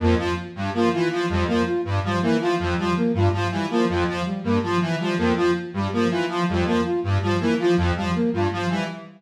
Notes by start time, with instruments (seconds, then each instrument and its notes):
0.00 lead 1 (square) F2, flute A#3
0.18 lead 1 (square) F3, flute F4
0.55 lead 1 (square) G2, flute G3
0.74 lead 1 (square) F3, flute A#3
0.93 lead 1 (square) E3, flute F4
1.11 lead 1 (square) F3
1.29 lead 1 (square) F2, flute G3
1.48 lead 1 (square) F3, flute A#3
1.66 flute F4
1.85 lead 1 (square) G2
2.04 lead 1 (square) F3, flute G3
2.22 lead 1 (square) E3, flute A#3
2.41 lead 1 (square) F3, flute F4
2.59 lead 1 (square) F2
2.78 lead 1 (square) F3, flute G3
2.97 flute A#3
3.14 lead 1 (square) G2, flute F4
3.33 lead 1 (square) F3
3.51 lead 1 (square) E3, flute G3
3.70 lead 1 (square) F3, flute A#3
3.89 lead 1 (square) F2, flute F4
4.08 lead 1 (square) F3
4.26 flute G3
4.44 lead 1 (square) G2, flute A#3
4.63 lead 1 (square) F3, flute F4
4.81 lead 1 (square) E3
5.00 lead 1 (square) F3, flute G3
5.18 lead 1 (square) F2, flute A#3
5.36 lead 1 (square) F3, flute F4
5.73 lead 1 (square) G2, flute G3
5.93 lead 1 (square) F3, flute A#3
6.10 lead 1 (square) E3, flute F4
6.29 lead 1 (square) F3
6.48 lead 1 (square) F2, flute G3
6.66 lead 1 (square) F3, flute A#3
6.85 flute F4
7.03 lead 1 (square) G2
7.22 lead 1 (square) F3, flute G3
7.40 lead 1 (square) E3, flute A#3
7.59 lead 1 (square) F3, flute F4
7.77 lead 1 (square) F2
7.96 lead 1 (square) F3, flute G3
8.15 flute A#3
8.33 lead 1 (square) G2, flute F4
8.52 lead 1 (square) F3
8.69 lead 1 (square) E3, flute G3